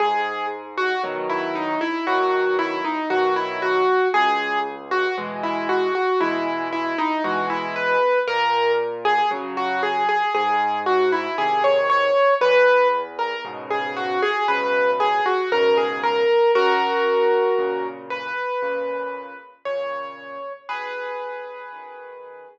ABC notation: X:1
M:4/4
L:1/16
Q:1/4=58
K:B
V:1 name="Acoustic Grand Piano"
G2 z F z E D E F2 E D F E F2 | G2 z F z E F F E2 E D F E B2 | A2 z G z F G G G2 F E G c c2 | B2 z A z G F G B2 G F A G A2 |
[FA]6 B6 c4 | [GB]8 z8 |]
V:2 name="Acoustic Grand Piano" clef=bass
G,,4 [B,,D,F,]4 [B,,D,F,]4 [B,,D,F,]4 | C,,4 [B,,E,G,]4 [B,,E,G,]4 [B,,E,G,]4 | A,,4 [C,F,]4 G,,4 [^B,,D,]4 | E,,4 [G,,B,,C,]4 [G,,B,,C,]4 [G,,B,,C,]4 |
F,,4 [A,,C,]4 [A,,C,]4 [A,,C,]4 | B,,,4 [F,,D,]4 z8 |]